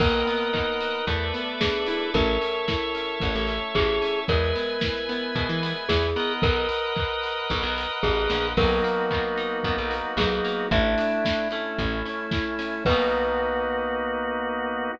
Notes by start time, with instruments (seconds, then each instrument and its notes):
0.00 electric bass (finger) B1, acoustic guitar (steel) A#3, drawbar organ A#4 B4 D#5 F#5, glockenspiel A#4, kick, crash
0.27 acoustic guitar (steel) B3, open hi-hat
0.53 acoustic guitar (steel) D#4, kick, clap
0.80 acoustic guitar (steel) F#4, open hi-hat
1.07 electric bass (finger) E2, acoustic guitar (steel) A3, drawbar organ A4 B4 D5 E5, kick, closed hi-hat
1.34 acoustic guitar (steel) B3, open hi-hat
1.61 acoustic guitar (steel) D4, glockenspiel G#4, kick, snare
1.86 acoustic guitar (steel) E4, open hi-hat
2.14 electric bass (finger) A1, acoustic guitar (steel) A3, drawbar organ A4 C#5 E5, glockenspiel A#4, kick, closed hi-hat
2.41 acoustic guitar (steel) C#4, open hi-hat
2.68 acoustic guitar (steel) E4, kick, snare
2.95 acoustic guitar (steel) C#4, open hi-hat
3.20 electric bass (finger) A1, acoustic guitar (steel) A3, kick, closed hi-hat
3.35 electric bass (finger) A1
3.47 acoustic guitar (steel) C#4, open hi-hat
3.75 electric bass (finger) A1, acoustic guitar (steel) E4, glockenspiel G#4, kick, clap
4.02 acoustic guitar (steel) C#4, open hi-hat
4.28 electric bass (finger) E2, acoustic guitar (steel) G#3, glockenspiel A#4, drawbar organ B4 E5 G#5, kick, closed hi-hat
4.55 acoustic guitar (steel) B3, open hi-hat
4.81 acoustic guitar (steel) E4, kick, snare
5.09 acoustic guitar (steel) B3, open hi-hat
5.35 electric bass (finger) B2, acoustic guitar (steel) G#3, kick, closed hi-hat
5.49 electric bass (finger) E3
5.62 acoustic guitar (steel) B3, open hi-hat
5.89 electric bass (finger) E2, acoustic guitar (steel) E4, glockenspiel G#4, kick, snare
6.16 acoustic guitar (steel) B3, drawbar organ A#4 B4 D#5 F#5, open hi-hat
6.42 electric bass (finger) B1, glockenspiel A#4, kick, closed hi-hat
6.69 open hi-hat
6.96 kick, clap
7.23 open hi-hat
7.50 electric bass (finger) B1, kick, closed hi-hat
7.63 electric bass (finger) B1
7.78 open hi-hat
8.03 electric bass (finger) A1, glockenspiel G#4, kick
8.30 electric bass (finger) A#1, snare
8.57 electric bass (finger) B1, acoustic guitar (steel) F#3, drawbar organ A#3 B3 D#4 F#4, glockenspiel A#4, kick, crash
8.84 acoustic guitar (steel) A#3, open hi-hat
9.11 acoustic guitar (steel) B3, kick, clap
9.37 acoustic guitar (steel) D#4, open hi-hat
9.63 electric bass (finger) F#2, acoustic guitar (steel) B3, kick, closed hi-hat
9.78 electric bass (finger) B1
9.91 acoustic guitar (steel) A#3, open hi-hat
10.17 electric bass (finger) B1, acoustic guitar (steel) F#3, glockenspiel G#4, kick, snare
10.45 acoustic guitar (steel) A#3, open hi-hat
10.71 electric bass (finger) A1, drawbar organ A3 D4 E4, acoustic guitar (steel) A3, glockenspiel E5, kick, closed hi-hat
10.98 acoustic guitar (steel) D4, open hi-hat
11.25 acoustic guitar (steel) E4, kick, snare
11.51 drawbar organ A3 C#4 E4, acoustic guitar (steel) A3, open hi-hat
11.78 electric bass (finger) A1, kick, closed hi-hat
12.05 acoustic guitar (steel) C#4, open hi-hat
12.31 acoustic guitar (steel) E4, kick, snare
12.59 acoustic guitar (steel) C#4, open hi-hat
12.85 electric bass (finger) B1, drawbar organ A#3 B3 D#4 F#4, acoustic guitar (steel) B3 D#4 F#4, glockenspiel B4, kick, crash
12.91 acoustic guitar (steel) A#3